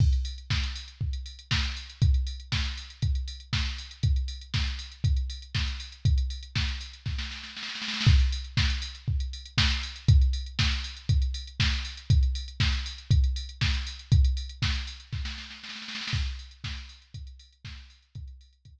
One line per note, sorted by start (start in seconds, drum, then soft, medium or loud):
0.00 kick loud
0.00 crash medium
0.13 closed hi-hat medium
0.25 open hi-hat medium
0.38 closed hi-hat medium
0.50 kick medium
0.50 snare medium
0.64 closed hi-hat medium
0.76 open hi-hat medium
0.88 closed hi-hat medium
1.01 kick medium
1.13 closed hi-hat medium
1.26 open hi-hat medium
1.39 closed hi-hat medium
1.51 kick medium
1.51 snare loud
1.63 closed hi-hat medium
1.77 open hi-hat medium
1.90 closed hi-hat medium
2.02 kick loud
2.02 closed hi-hat medium
2.14 closed hi-hat medium
2.27 open hi-hat medium
2.40 closed hi-hat medium
2.52 kick medium
2.52 snare medium
2.65 closed hi-hat medium
2.77 open hi-hat medium
2.90 closed hi-hat medium
3.02 kick medium
3.02 closed hi-hat medium
3.15 closed hi-hat medium
3.28 open hi-hat medium
3.40 closed hi-hat medium
3.53 kick medium
3.53 snare medium
3.66 closed hi-hat medium
3.78 open hi-hat medium
3.91 closed hi-hat medium
4.03 kick medium
4.03 closed hi-hat medium
4.16 closed hi-hat medium
4.28 open hi-hat medium
4.41 closed hi-hat medium
4.54 kick medium
4.54 snare medium
4.67 closed hi-hat medium
4.79 open hi-hat medium
4.92 closed hi-hat medium
5.04 kick medium
5.04 closed hi-hat medium
5.16 closed hi-hat medium
5.30 open hi-hat medium
5.42 closed hi-hat medium
5.55 kick medium
5.55 snare medium
5.67 closed hi-hat medium
5.80 open hi-hat medium
5.92 closed hi-hat medium
6.05 kick medium
6.05 closed hi-hat medium
6.18 closed hi-hat medium
6.30 open hi-hat medium
6.43 closed hi-hat medium
6.55 kick medium
6.55 snare medium
6.68 closed hi-hat medium
6.81 open hi-hat medium
6.93 closed hi-hat medium
7.06 kick medium
7.06 snare medium
7.18 snare medium
7.31 snare medium
7.43 snare medium
7.57 snare medium
7.63 snare medium
7.69 snare medium
7.75 snare medium
7.82 snare medium
7.88 snare medium
7.94 snare medium
8.01 snare medium
8.06 kick loud
8.06 crash medium
8.19 closed hi-hat medium
8.32 open hi-hat medium
8.44 closed hi-hat medium
8.57 kick medium
8.57 snare loud
8.70 closed hi-hat medium
8.82 open hi-hat medium
8.95 closed hi-hat medium
9.08 kick medium
9.20 closed hi-hat medium
9.33 open hi-hat medium
9.45 closed hi-hat medium
9.58 kick medium
9.58 snare loud
9.70 closed hi-hat medium
9.83 open hi-hat medium
9.96 closed hi-hat medium
10.08 kick loud
10.08 closed hi-hat loud
10.22 closed hi-hat medium
10.33 open hi-hat medium
10.46 closed hi-hat medium
10.59 kick medium
10.59 snare loud
10.71 closed hi-hat medium
10.84 open hi-hat medium
10.97 closed hi-hat medium
11.09 kick medium
11.09 closed hi-hat medium
11.22 closed hi-hat medium
11.34 open hi-hat medium
11.47 closed hi-hat medium
11.60 kick medium
11.60 snare loud
11.72 closed hi-hat medium
11.85 open hi-hat medium
11.97 closed hi-hat medium
12.10 kick loud
12.10 closed hi-hat loud
12.23 closed hi-hat medium
12.35 open hi-hat medium
12.48 closed hi-hat medium
12.60 kick medium
12.60 snare loud
12.73 closed hi-hat medium
12.86 open hi-hat medium
12.98 closed hi-hat medium
13.11 kick loud
13.11 closed hi-hat loud
13.24 closed hi-hat medium
13.36 open hi-hat medium
13.49 closed hi-hat medium
13.61 kick medium
13.61 snare medium
13.74 closed hi-hat medium
13.87 open hi-hat medium
13.99 closed hi-hat medium
14.12 kick loud
14.12 closed hi-hat loud
14.24 closed hi-hat medium
14.37 open hi-hat medium
14.49 closed hi-hat medium
14.62 kick medium
14.62 snare loud
14.75 closed hi-hat medium
14.87 open hi-hat medium
15.00 closed hi-hat medium
15.13 kick medium
15.13 snare medium
15.25 snare medium
15.38 snare medium
15.50 snare medium
15.63 snare medium
15.69 snare medium
15.76 snare medium
15.82 snare medium
15.88 snare medium
15.95 snare medium
16.01 snare medium
16.07 snare loud
16.13 kick loud
16.13 crash loud
16.26 closed hi-hat medium
16.39 open hi-hat medium
16.51 closed hi-hat medium
16.64 kick medium
16.64 snare loud
16.77 closed hi-hat medium
16.89 open hi-hat medium
17.02 closed hi-hat medium
17.14 kick medium
17.14 closed hi-hat medium
17.27 closed hi-hat medium
17.39 open hi-hat medium
17.53 closed hi-hat medium
17.65 kick medium
17.65 snare medium
17.78 closed hi-hat medium
17.90 open hi-hat medium
18.02 closed hi-hat medium
18.15 kick loud
18.15 closed hi-hat medium
18.28 closed hi-hat medium
18.41 open hi-hat medium
18.53 closed hi-hat medium
18.65 kick medium
18.65 closed hi-hat medium
18.79 closed hi-hat medium